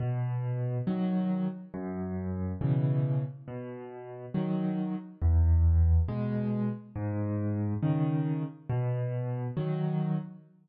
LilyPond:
\new Staff { \clef bass \time 6/8 \key b \major \tempo 4. = 69 b,4. <dis fis>4. | fis,4. <b, cis e>4. | b,4. <dis fis>4. | e,4. <b, gis>4. |
gis,4. <cis dis>4. | b,4. <dis fis>4. | }